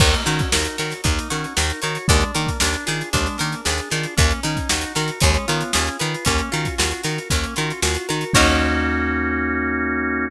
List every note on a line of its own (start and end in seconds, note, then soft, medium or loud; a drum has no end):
0.00 0.15 D#2 loud
0.00 0.24 A#3 medium
0.00 1.04 D#4 medium
0.00 kick loud
0.00 crash loud
0.14 closed hi-hat medium
0.25 0.41 D#3 medium
0.25 0.49 C#4 medium
0.25 1.30 F#4 medium
0.25 closed hi-hat medium
0.39 kick medium
0.39 closed hi-hat medium
0.52 0.67 D#2 medium
0.52 0.77 D#4 medium
0.52 1.56 A#4 medium
0.52 snare loud
0.65 closed hi-hat medium
0.78 0.94 D#3 medium
0.78 1.01 F#4 medium
0.78 1.82 C#5 medium
0.78 snare medium
0.78 closed hi-hat medium
0.90 snare soft
0.90 closed hi-hat medium
1.04 1.19 D#2 medium
1.04 1.28 A#3 medium
1.04 2.03 D#4 medium
1.04 kick loud
1.04 closed hi-hat loud
1.19 closed hi-hat medium
1.30 1.46 D#3 medium
1.30 1.54 C#4 medium
1.30 2.05 F#4 medium
1.30 closed hi-hat medium
1.44 closed hi-hat medium
1.57 1.72 D#2 medium
1.57 1.81 D#4 medium
1.57 2.06 A#4 medium
1.57 snare loud
1.70 closed hi-hat medium
1.82 1.98 D#3 medium
1.82 2.07 F#4 medium
1.82 2.07 C#5 medium
1.82 closed hi-hat medium
1.95 closed hi-hat medium
2.08 2.24 D#2 loud
2.08 2.32 G#3 medium
2.08 2.60 D4 medium
2.08 kick loud
2.08 closed hi-hat loud
2.21 closed hi-hat medium
2.34 2.50 D#3 medium
2.34 2.58 A#3 medium
2.34 3.39 A#4 medium
2.34 closed hi-hat medium
2.47 kick medium
2.47 closed hi-hat medium
2.60 2.76 D#2 medium
2.60 3.12 D4 medium
2.60 2.85 D4 medium
2.60 snare loud
2.73 closed hi-hat medium
2.86 3.03 D#3 medium
2.86 3.09 F4 medium
2.86 3.65 G#4 medium
2.86 snare medium
2.86 closed hi-hat medium
3.01 closed hi-hat medium
3.13 3.28 D#2 medium
3.13 3.37 G#3 medium
3.13 3.91 D4 medium
3.13 kick medium
3.13 closed hi-hat loud
3.26 snare soft
3.26 closed hi-hat medium
3.38 3.55 D#3 medium
3.38 3.61 A#3 medium
3.38 4.13 A#4 medium
3.38 snare soft
3.38 closed hi-hat medium
3.52 closed hi-hat medium
3.65 3.81 D#2 medium
3.65 3.89 D4 medium
3.65 4.15 G#4 medium
3.65 snare loud
3.78 closed hi-hat medium
3.90 4.06 D#3 medium
3.90 4.16 D4 medium
3.90 4.14 F4 medium
3.90 snare soft
3.90 closed hi-hat medium
4.03 closed hi-hat medium
4.17 4.33 D#2 loud
4.17 4.40 A#3 medium
4.17 5.17 C#4 medium
4.17 kick loud
4.17 closed hi-hat loud
4.30 closed hi-hat medium
4.43 4.59 D#3 medium
4.43 4.68 C#4 medium
4.43 5.18 D#4 medium
4.43 closed hi-hat medium
4.57 kick medium
4.57 closed hi-hat medium
4.69 4.85 D#2 medium
4.69 4.93 D#4 medium
4.69 5.19 F#4 medium
4.69 snare loud
4.81 closed hi-hat medium
4.95 5.11 D#3 medium
4.95 5.19 F#4 medium
4.95 5.20 A#4 medium
4.95 snare medium
4.95 closed hi-hat medium
5.08 closed hi-hat medium
5.20 5.37 D#2 loud
5.20 5.46 G#3 medium
5.20 6.21 C#4 medium
5.20 kick loud
5.20 closed hi-hat loud
5.34 closed hi-hat medium
5.48 5.63 D#3 medium
5.48 5.72 B3 medium
5.48 6.22 F4 medium
5.48 closed hi-hat medium
5.61 closed hi-hat medium
5.73 5.89 D#2 medium
5.73 5.97 C#4 medium
5.73 6.23 G#4 medium
5.73 snare loud
5.87 closed hi-hat medium
5.99 6.16 D#3 medium
5.99 6.24 F4 medium
5.99 6.25 B4 medium
5.99 closed hi-hat medium
6.14 closed hi-hat medium
6.25 6.41 D#2 medium
6.25 6.49 A#3 medium
6.25 7.30 C#4 medium
6.25 kick medium
6.25 closed hi-hat loud
6.38 closed hi-hat medium
6.51 6.68 D#3 medium
6.51 7.56 F4 medium
6.51 6.75 F#4 medium
6.51 snare soft
6.51 closed hi-hat medium
6.65 kick medium
6.65 closed hi-hat medium
6.78 6.93 D#2 medium
6.78 7.01 F4 medium
6.78 7.82 F#4 medium
6.78 snare loud
6.91 closed hi-hat medium
7.03 7.19 D#3 medium
7.03 7.28 F#4 medium
7.03 8.08 A#4 medium
7.03 snare medium
7.03 closed hi-hat medium
7.18 closed hi-hat medium
7.30 7.46 D#2 medium
7.30 7.54 A#3 medium
7.30 8.29 C#4 medium
7.30 kick medium
7.30 closed hi-hat loud
7.43 closed hi-hat medium
7.56 7.72 D#3 medium
7.56 8.31 F4 medium
7.56 7.80 F#4 medium
7.56 closed hi-hat medium
7.70 closed hi-hat medium
7.82 7.97 D#2 medium
7.82 8.06 F4 medium
7.82 8.32 F#4 medium
7.82 snare loud
7.95 closed hi-hat medium
8.09 8.24 D#3 medium
8.09 8.33 F#4 medium
8.09 8.34 A#4 medium
8.09 closed hi-hat medium
8.21 closed hi-hat medium
8.33 10.30 D#2 loud
8.33 10.28 A#3 loud
8.33 10.28 C#4 loud
8.33 10.28 D#4 medium
8.33 10.29 D#4 loud
8.33 10.28 F#4 loud
8.33 10.29 F#4 medium
8.33 10.29 A#4 loud
8.33 10.29 C#5 loud
8.33 kick loud
8.33 crash loud